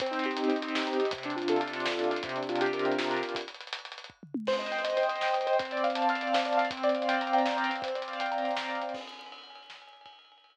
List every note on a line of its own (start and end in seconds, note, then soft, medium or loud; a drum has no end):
0.00 0.48 C4 loud
0.00 kick loud
0.00 closed hi-hat loud
0.06 closed hi-hat medium
0.11 0.37 D#4 medium
0.11 closed hi-hat medium
0.19 closed hi-hat medium
0.24 0.75 G4 medium
0.24 closed hi-hat medium
0.31 closed hi-hat medium
0.37 0.61 D#4 medium
0.37 closed hi-hat medium
0.44 closed hi-hat medium
0.48 0.97 C4 medium
0.48 closed hi-hat medium
0.56 closed hi-hat medium
0.62 0.87 D#4 medium
0.62 closed hi-hat medium
0.68 closed hi-hat medium
0.75 1.11 G4 medium
0.75 snare loud
0.82 closed hi-hat medium
0.87 1.11 D#4 medium
0.87 closed hi-hat medium
0.93 closed hi-hat medium
0.98 1.09 C4 medium
0.98 closed hi-hat medium
1.05 closed hi-hat medium
1.11 1.86 C3 loud
1.11 kick loud
1.11 closed hi-hat loud
1.18 closed hi-hat medium
1.23 1.72 D4 medium
1.23 closed hi-hat medium
1.30 closed hi-hat medium
1.36 1.60 F4 medium
1.36 closed hi-hat medium
1.42 closed hi-hat medium
1.48 2.20 A4 medium
1.48 closed hi-hat loud
1.56 2.10 F4 medium
1.56 closed hi-hat medium
1.61 closed hi-hat medium
1.68 closed hi-hat medium
1.73 1.99 D4 medium
1.73 closed hi-hat medium
1.80 closed hi-hat medium
1.86 2.22 C3 medium
1.86 snare loud
1.92 closed hi-hat medium
1.99 2.23 D4 medium
1.99 closed hi-hat medium
2.04 closed hi-hat medium
2.11 2.23 F4 medium
2.11 closed hi-hat medium
2.16 closed hi-hat medium
2.23 3.23 C3 loud
2.23 kick loud
2.23 closed hi-hat medium
2.29 closed hi-hat medium
2.36 3.09 D4 medium
2.36 closed hi-hat medium
2.43 closed hi-hat medium
2.49 2.98 F4 medium
2.49 closed hi-hat medium
2.56 closed hi-hat medium
2.61 2.85 G4 medium
2.61 closed hi-hat medium
2.66 closed hi-hat medium
2.73 3.32 A#4 medium
2.73 closed hi-hat medium
2.79 closed hi-hat medium
2.85 3.33 G4 medium
2.85 closed hi-hat medium
2.92 closed hi-hat medium
2.98 3.34 F4 medium
2.98 snare loud
3.04 closed hi-hat medium
3.10 3.33 D4 medium
3.10 closed hi-hat medium
3.17 closed hi-hat medium
3.23 3.35 C3 medium
3.23 closed hi-hat medium
3.29 closed hi-hat medium
3.35 kick medium
3.35 closed hi-hat loud
3.41 closed hi-hat medium
3.48 closed hi-hat medium
3.54 closed hi-hat medium
3.61 closed hi-hat medium
3.67 closed hi-hat medium
3.73 closed hi-hat loud
3.79 closed hi-hat medium
3.85 closed hi-hat medium
3.92 closed hi-hat medium
3.98 closed hi-hat medium
4.04 closed hi-hat medium
4.10 kick medium
4.23 floor tom medium
4.34 mid tom loud
4.47 4.97 C5 loud
4.47 kick medium
4.47 crash loud
4.53 closed hi-hat medium
4.59 4.84 D#5 medium
4.59 closed hi-hat medium
4.66 closed hi-hat medium
4.72 5.22 G5 medium
4.72 closed hi-hat medium
4.79 closed hi-hat medium
4.84 5.08 D#5 medium
4.84 closed hi-hat loud
4.90 closed hi-hat medium
4.97 5.46 C5 medium
4.97 closed hi-hat medium
5.03 closed hi-hat medium
5.09 5.33 D#5 medium
5.09 closed hi-hat medium
5.16 closed hi-hat medium
5.21 5.58 G5 medium
5.21 snare medium
5.28 closed hi-hat medium
5.33 5.57 D#5 medium
5.33 closed hi-hat medium
5.41 closed hi-hat medium
5.47 5.59 C5 medium
5.47 closed hi-hat medium
5.53 closed hi-hat medium
5.59 6.34 C4 loud
5.59 kick loud
5.59 closed hi-hat medium
5.65 closed hi-hat medium
5.71 6.22 D5 medium
5.71 closed hi-hat medium
5.77 closed hi-hat medium
5.84 6.09 F5 medium
5.84 closed hi-hat medium
5.90 closed hi-hat medium
5.95 6.66 A5 medium
5.95 closed hi-hat loud
6.02 closed hi-hat medium
6.09 6.57 F5 medium
6.09 closed hi-hat medium
6.15 closed hi-hat medium
6.21 6.45 D5 medium
6.21 closed hi-hat medium
6.27 closed hi-hat medium
6.34 6.70 C4 medium
6.34 snare loud
6.34 closed hi-hat soft
6.39 closed hi-hat medium
6.45 6.69 D5 medium
6.45 closed hi-hat medium
6.53 closed hi-hat medium
6.57 6.69 F5 medium
6.57 closed hi-hat medium
6.65 closed hi-hat medium
6.71 7.69 C4 loud
6.71 kick loud
6.71 closed hi-hat medium
6.77 closed hi-hat medium
6.83 7.57 D5 medium
6.83 closed hi-hat medium
6.89 closed hi-hat medium
6.95 7.45 F5 medium
6.95 closed hi-hat medium
7.02 closed hi-hat medium
7.08 7.33 G5 medium
7.08 closed hi-hat loud
7.14 closed hi-hat medium
7.21 7.81 A#5 medium
7.21 closed hi-hat medium
7.27 closed hi-hat medium
7.33 7.81 G5 medium
7.33 closed hi-hat medium
7.39 closed hi-hat medium
7.45 7.81 F5 medium
7.45 snare medium
7.51 closed hi-hat medium
7.57 7.81 D5 medium
7.57 closed hi-hat medium
7.64 closed hi-hat medium
7.69 7.81 C4 medium
7.69 closed hi-hat medium
7.76 closed hi-hat medium
7.82 8.82 C4 loud
7.82 kick medium
7.82 closed hi-hat medium
7.88 closed hi-hat medium
7.95 8.69 D5 medium
7.95 closed hi-hat medium
8.02 closed hi-hat medium
8.08 8.57 F5 medium
8.08 closed hi-hat medium
8.13 closed hi-hat medium
8.20 8.44 G5 medium
8.20 closed hi-hat medium
8.26 closed hi-hat medium
8.32 8.91 A#5 medium
8.32 closed hi-hat medium
8.38 closed hi-hat medium
8.45 8.92 G5 medium
8.45 closed hi-hat medium
8.51 closed hi-hat medium
8.57 8.93 F5 medium
8.57 snare loud
8.64 closed hi-hat medium
8.69 8.93 D5 medium
8.69 closed hi-hat medium
8.75 closed hi-hat medium
8.82 8.95 C4 medium
8.82 closed hi-hat medium
8.89 closed hi-hat medium
8.94 kick loud
8.94 crash loud
9.01 ride medium
9.07 ride medium
9.13 ride medium
9.19 ride medium
9.26 ride medium
9.32 ride medium
9.38 ride medium
9.43 ride medium
9.50 ride medium
9.55 ride medium
9.63 ride medium
9.70 snare loud
9.76 ride medium
9.82 ride medium
9.87 ride medium
9.93 ride medium
10.01 ride medium
10.06 kick loud
10.06 ride loud
10.13 ride medium
10.19 ride medium
10.25 ride medium
10.32 ride medium
10.38 ride medium
10.44 ride loud
10.50 ride medium